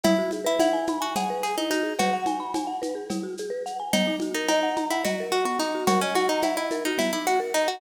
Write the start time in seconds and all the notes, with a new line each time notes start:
0.03 E4, cowbell, low conga, shaker
0.18 F#4
0.31 G#4, high conga, shaker
0.44 E4 B4
0.59 E4 F#5, cowbell, high conga, shaker
0.73 G#5
0.87 B5, high conga, shaker
1.00 F#4 G#5
1.16 G#4 F#5, cowbell, low conga, shaker
1.30 B4
1.43 G#4, shaker
1.58 D#4 E4
1.70 D#4 F#4, shaker
1.83 G#4
1.99 F#4 B4, cowbell, low conga, shaker
2.13 F#5
2.26 G#5, high conga, shaker
2.40 B5
2.54 G#5, cowbell, high conga, shaker
2.67 F#5
2.82 B4, high conga, shaker
2.95 G#4
3.10 E4, cowbell, low conga, shaker
3.23 F#4
3.38 G#4, shaker
3.50 B4
3.66 F#5, shaker
3.80 G#5
3.93 B3 D#4, cowbell, low conga, shaker
4.07 D#4
4.20 F#4, high conga, shaker
4.34 D#4 A#4
4.48 D#4 D#5, cowbell, high conga, shaker
4.63 F#5
4.77 A#5, high conga, shaker
4.91 E4 F#5
5.04 F#4 D#5, cowbell, low conga, shaker
5.20 A#4
5.31 F#4, shaker
5.45 B3 F#4
5.59 D#4, shaker
5.75 F#4
5.87 F#4 A#4, cowbell, low conga, shaker
6.01 C#4 D#5
6.15 F#4 F#5, high conga, shaker
6.29 D#4 A#5
6.42 E4 F#5, cowbell, high conga, shaker
6.57 E4 D#5
6.71 A#4, high conga, shaker
6.85 D#4 F#4
6.98 B3 E4, cowbell, low conga, shaker
7.13 D#4 E4
7.26 F#4, shaker
7.40 A#4
7.54 D#4 D#5, shaker
7.68 F#4 F#5